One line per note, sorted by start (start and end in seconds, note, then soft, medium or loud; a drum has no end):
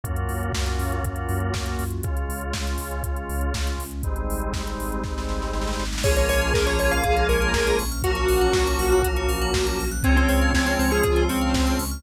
0.04 0.25 F#2 medium
0.04 2.01 A#3 medium
0.04 1.84 A#3 loud
0.04 2.01 C#4 medium
0.04 1.84 C#4 loud
0.04 2.01 F4 medium
0.04 1.84 F4 medium
0.04 2.01 F#4 medium
0.04 1.84 F#4 medium
0.04 kick medium
0.04 closed hi-hat medium
0.16 closed hi-hat medium
0.29 0.50 F#2 medium
0.29 open hi-hat medium
0.43 closed hi-hat medium
0.53 0.75 F#2 medium
0.53 kick medium
0.53 snare medium
0.66 closed hi-hat soft
0.79 1.00 F#2 medium
0.79 open hi-hat medium
0.92 closed hi-hat medium
1.04 1.25 F#2 medium
1.04 kick medium
1.04 closed hi-hat medium
1.16 closed hi-hat medium
1.29 1.51 F#2 medium
1.29 open hi-hat medium
1.40 closed hi-hat soft
1.54 1.75 F#2 medium
1.54 kick medium
1.54 snare medium
1.66 closed hi-hat medium
1.79 2.00 F#2 medium
1.79 open hi-hat medium
1.90 closed hi-hat medium
2.03 2.25 C#2 medium
2.03 3.84 G#3 medium
2.03 4.02 G#3 medium
2.03 3.84 C#4 medium
2.03 4.02 C#4 medium
2.03 3.84 F4 loud
2.03 4.02 F4 medium
2.03 kick medium
2.03 closed hi-hat medium
2.17 closed hi-hat medium
2.29 2.50 C#2 medium
2.29 open hi-hat medium
2.41 closed hi-hat medium
2.53 2.75 C#2 medium
2.53 kick medium
2.53 snare medium
2.67 closed hi-hat soft
2.78 3.00 C#2 medium
2.78 open hi-hat medium
2.91 closed hi-hat medium
3.03 3.25 C#2 medium
3.03 kick medium
3.03 closed hi-hat medium
3.16 closed hi-hat medium
3.29 3.50 C#2 medium
3.29 open hi-hat medium
3.41 closed hi-hat medium
3.54 3.76 C#2 medium
3.54 kick medium
3.54 snare medium
3.67 closed hi-hat medium
3.79 4.00 C#2 medium
3.79 open hi-hat medium
3.91 closed hi-hat medium
4.03 4.25 G#1 medium
4.03 6.02 G3 medium
4.03 5.84 G3 medium
4.03 6.02 G#3 medium
4.03 5.84 G#3 medium
4.03 6.02 C4 medium
4.03 5.84 C4 medium
4.03 6.02 D#4 medium
4.03 5.84 D#4 medium
4.03 kick medium
4.03 closed hi-hat medium
4.16 closed hi-hat medium
4.29 4.50 G#1 medium
4.29 open hi-hat medium
4.41 closed hi-hat soft
4.53 4.76 G#1 medium
4.53 kick medium
4.53 snare medium
4.67 closed hi-hat medium
4.78 5.00 G#1 medium
4.78 open hi-hat medium
4.92 closed hi-hat medium
5.04 5.25 G#1 medium
5.04 kick medium
5.04 snare medium
5.18 snare medium
5.29 5.50 G#1 medium
5.29 snare medium
5.42 snare medium
5.53 5.75 G#1 medium
5.53 snare medium
5.61 snare medium
5.67 snare medium
5.73 snare medium
5.79 6.00 G#1 medium
5.79 snare medium
5.85 snare medium
5.93 snare medium
5.98 snare medium
6.03 6.26 A#1 medium
6.03 8.02 F3 loud
6.03 7.84 F3 loud
6.03 8.02 G#3 medium
6.03 7.84 G#3 loud
6.03 8.02 A#3 medium
6.03 7.84 A#3 loud
6.03 8.02 C#4 medium
6.03 7.84 C#4 loud
6.03 6.15 G#4 loud
6.03 7.82 G#4 medium
6.03 6.16 C#5 medium
6.03 kick medium
6.03 crash medium
6.16 6.28 A#4 medium
6.16 6.28 C#5 medium
6.16 closed hi-hat medium
6.29 6.50 A#1 medium
6.29 6.50 C#5 medium
6.29 6.40 C#5 loud
6.29 open hi-hat medium
6.41 6.53 F5 medium
6.41 closed hi-hat medium
6.54 6.76 A#1 medium
6.54 6.66 A#4 medium
6.54 6.65 G#5 loud
6.54 kick medium
6.54 snare medium
6.66 6.78 C#5 medium
6.66 6.78 A#5 medium
6.66 closed hi-hat medium
6.79 7.01 A#1 medium
6.79 6.91 C#5 medium
6.79 6.90 C#6 medium
6.79 open hi-hat medium
6.91 7.27 F5 medium
6.91 7.03 F6 medium
6.91 closed hi-hat medium
7.04 7.25 A#1 medium
7.04 7.15 G#4 loud
7.04 kick medium
7.04 closed hi-hat medium
7.17 7.28 A#4 medium
7.17 closed hi-hat medium
7.29 7.50 A#1 medium
7.29 7.77 A#4 medium
7.29 7.40 C#5 medium
7.29 open hi-hat medium
7.41 7.52 F5 medium
7.41 closed hi-hat medium
7.54 7.75 A#1 medium
7.54 7.65 G#5 loud
7.54 kick medium
7.54 snare medium
7.66 7.78 A#5 medium
7.66 closed hi-hat medium
7.79 8.00 A#1 medium
7.79 7.90 C#6 medium
7.79 open hi-hat medium
7.91 8.03 F6 medium
7.91 closed hi-hat medium
8.03 8.25 A#1 medium
8.03 9.84 F3 loud
8.03 10.02 F3 medium
8.03 9.84 F#3 loud
8.03 10.02 F#3 medium
8.03 9.84 A#3 loud
8.03 10.02 A#3 medium
8.03 9.84 C#4 loud
8.03 10.02 C#4 medium
8.03 9.88 F#4 medium
8.03 9.07 F#4 medium
8.03 8.15 A#4 loud
8.03 kick medium
8.03 closed hi-hat medium
8.15 8.28 C#5 medium
8.15 closed hi-hat medium
8.28 8.51 A#1 medium
8.28 8.40 F5 medium
8.28 open hi-hat medium
8.41 8.53 F#5 medium
8.41 closed hi-hat medium
8.53 8.75 A#1 medium
8.53 8.65 A#5 medium
8.53 kick medium
8.53 snare medium
8.66 8.78 C#6 medium
8.66 closed hi-hat medium
8.79 9.00 A#1 medium
8.79 8.91 F6 medium
8.79 open hi-hat medium
8.92 9.03 F#6 medium
8.92 closed hi-hat medium
9.03 9.26 A#1 medium
9.03 9.15 A#4 medium
9.03 kick medium
9.03 closed hi-hat loud
9.16 9.28 C#5 medium
9.16 closed hi-hat medium
9.29 9.50 A#1 medium
9.29 9.41 F5 medium
9.29 open hi-hat medium
9.41 9.53 F#5 medium
9.41 closed hi-hat medium
9.54 9.75 A#1 medium
9.54 9.65 A#5 medium
9.54 kick medium
9.54 snare medium
9.66 9.78 C#6 medium
9.66 closed hi-hat medium
9.79 10.01 A#1 medium
9.79 9.90 F6 medium
9.79 open hi-hat medium
9.91 10.03 F#6 medium
9.91 closed hi-hat medium
10.03 10.25 C#2 loud
10.03 12.02 F3 loud
10.03 11.84 F3 loud
10.03 12.02 G#3 medium
10.03 11.84 G#3 medium
10.03 12.02 C4 medium
10.03 11.84 C4 loud
10.03 10.16 C4 medium
10.03 12.02 C#4 medium
10.03 11.84 C#4 loud
10.03 10.15 G#4 loud
10.03 11.01 C#5 medium
10.03 kick medium
10.03 closed hi-hat medium
10.16 10.28 C4 medium
10.16 10.28 C5 medium
10.16 closed hi-hat medium
10.29 10.50 C#2 medium
10.29 10.51 C4 medium
10.29 10.40 C#5 medium
10.29 open hi-hat medium
10.41 10.53 F5 medium
10.41 closed hi-hat medium
10.53 10.75 C#2 medium
10.53 10.66 C4 medium
10.53 10.65 G#5 medium
10.53 kick medium
10.53 snare medium
10.66 10.78 C4 medium
10.66 10.77 C6 medium
10.66 closed hi-hat medium
10.79 11.00 C#2 medium
10.79 10.91 C4 medium
10.79 10.90 C#6 medium
10.79 open hi-hat medium
10.91 11.23 G#4 medium
10.91 11.03 F6 medium
10.91 closed hi-hat medium
11.03 11.26 C#2 medium
11.03 11.28 F4 medium
11.03 11.15 G#4 medium
11.03 kick medium
11.03 closed hi-hat medium
11.16 11.28 C5 medium
11.16 closed hi-hat medium
11.29 11.50 C#2 medium
11.29 11.78 C4 medium
11.29 11.40 C#5 medium
11.29 open hi-hat medium
11.41 11.53 F5 medium
11.41 closed hi-hat medium
11.54 11.75 C#2 medium
11.54 11.65 G#5 medium
11.54 kick medium
11.54 snare medium
11.66 11.78 C6 medium
11.66 closed hi-hat medium
11.79 12.00 C#2 medium
11.79 11.90 C#6 medium
11.79 open hi-hat medium
11.91 12.03 F6 medium
11.91 closed hi-hat medium